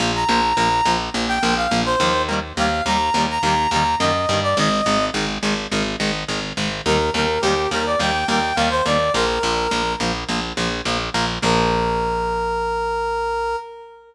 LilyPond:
<<
  \new Staff \with { instrumentName = "Brass Section" } { \time 4/4 \key bes \mixolydian \tempo 4 = 105 r16 bes''8. bes''8. r8 g''8 f''8 c''8. | r8 f''8 bes''8. bes''16 bes''8 bes''8 ees''8. d''16 | ees''4 r2. | bes'8 bes'8 g'8 bes'16 d''16 g''8 g''8 f''16 c''16 d''8 |
bes'4. r2 r8 | bes'1 | }
  \new Staff \with { instrumentName = "Overdriven Guitar" } { \time 4/4 \key bes \mixolydian <f bes>8 <f bes>8 <f bes>8 <f bes>8 <f bes>8 <f bes>8 <f bes>8 <f bes>8 | <ees g bes>8 <ees g bes>8 <ees g bes>8 <ees g bes>8 <ees g bes>8 <ees g bes>8 <ees g bes>8 <ees g bes>8 | <ees aes>8 <ees aes>8 <ees aes>8 <ees aes>8 <ees aes>8 <ees aes>8 <ees aes>8 <ees aes>8 | <ees g bes>8 <ees g bes>8 <ees g bes>8 <ees g bes>8 <ees g bes>8 <ees g bes>8 <ees g bes>8 <ees g bes>8 |
<f bes>8 <f bes>8 <f bes>8 <f bes>8 <f bes>8 <f bes>8 <f bes>8 <f bes>8 | <f bes>1 | }
  \new Staff \with { instrumentName = "Electric Bass (finger)" } { \clef bass \time 4/4 \key bes \mixolydian bes,,8 bes,,8 bes,,8 bes,,8 bes,,8 bes,,8 bes,,8 ees,8~ | ees,8 ees,8 ees,8 ees,8 ees,8 ees,8 ges,8 g,8 | aes,,8 aes,,8 aes,,8 aes,,8 aes,,8 aes,,8 aes,,8 aes,,8 | ees,8 ees,8 ees,8 ees,8 ees,8 ees,8 ees,8 ees,8 |
bes,,8 bes,,8 bes,,8 bes,,8 bes,,8 bes,,8 bes,,8 bes,,8 | bes,,1 | }
>>